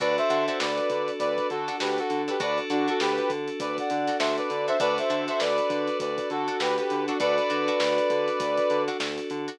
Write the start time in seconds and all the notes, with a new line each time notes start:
0.00 D2 D4 F#4 A4 B4 D5, kick, closed hi-hat
0.18 C5 E5, closed hi-hat
0.30 D3 D4 F#4 A4, closed hi-hat
0.47 D4 F#4 A4 C5 E5, closed hi-hat
0.60 D2 B4 D5, snare
0.78 closed hi-hat
0.90 D3, kick, closed hi-hat
1.08 closed hi-hat
1.19 D2 B4 D5, kick, closed hi-hat
1.38 kick, closed hi-hat
1.50 D3 F#4 A4, closed hi-hat
1.68 D4 F#4 A4, snare, closed hi-hat
1.80 D2 D4 F#4 G4 A4 B4, snare
1.98 F#4 A4, closed hi-hat
2.10 D3, closed hi-hat
2.28 D4 F#4 G4 A4 B4, snare, closed hi-hat
2.40 D2 D4 F#4 A4 B4 D5, kick, closed hi-hat
2.58 closed hi-hat
2.70 D3 D4 F#4 A4, closed hi-hat
2.88 D4 F#4 A4, closed hi-hat
3.00 D2 G4 B4, snare
3.18 closed hi-hat
3.30 D3, kick, closed hi-hat
3.48 closed hi-hat
3.60 D2 B4 D5, kick, closed hi-hat
3.78 D5 F#5, kick, closed hi-hat
3.90 D3, closed hi-hat
4.08 D4 F#4 A4, snare, closed hi-hat
4.19 D2 D4 F#4 A4 C5 E5, snare
4.37 B4 D5, closed hi-hat
4.50 D3, closed hi-hat
4.67 D4 F#4 A4 C5 E5, snare, closed hi-hat
4.80 D2 D4 F#4 A4 B4 D5, kick, closed hi-hat
4.98 C5 E5, closed hi-hat
5.10 D3 D4 F#4 A4, closed hi-hat
5.28 D4 F#4 A4 C5 E5, closed hi-hat
5.40 D2 B4 D5, snare
5.58 closed hi-hat
5.70 D3, kick, closed hi-hat
5.88 closed hi-hat
6.00 D2 B4 D5, kick, closed hi-hat
6.18 kick, closed hi-hat
6.30 D3 F#4 A4, closed hi-hat
6.48 D4 F#4 A4, closed hi-hat
6.60 D2 D4 F#4 G4 A4 B4, snare
6.77 G4 B4, snare, closed hi-hat
6.90 D3, closed hi-hat
7.07 D4 F#4 A4, closed hi-hat
7.20 D2 D4 F#4 A4 B4 D5, kick, closed hi-hat
7.38 closed hi-hat
7.50 D3 D4 F#4 A4, closed hi-hat
7.68 D4 F#4 A4, closed hi-hat
7.80 D2, snare
7.98 closed hi-hat
8.10 D3, kick, closed hi-hat
8.28 closed hi-hat
8.40 D2, kick, closed hi-hat
8.58 kick, closed hi-hat
8.70 D3, closed hi-hat
8.88 D4 F#4 A4, snare, closed hi-hat
9.00 D2 D4 F#4 A4, snare
9.18 closed hi-hat
9.30 D3, closed hi-hat
9.48 D4 F#4 A4, closed hi-hat